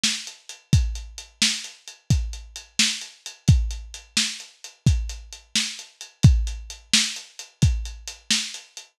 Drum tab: HH |-xx|xxx-xxxxx-xx|xxx-xxxxx-xx|xxx-xxxxx-xx|
SD |o--|---o-----o--|---o-----o--|---o-----o--|
BD |---|o-----o-----|o-----o-----|o-----o-----|